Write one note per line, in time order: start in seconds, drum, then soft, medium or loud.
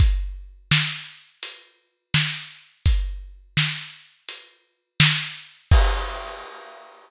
0.00 kick loud
0.00 closed hi-hat loud
0.71 snare loud
1.43 closed hi-hat loud
2.14 snare loud
2.86 kick medium
2.86 closed hi-hat loud
3.57 snare loud
4.29 closed hi-hat loud
5.00 snare loud
5.71 kick loud
5.71 crash loud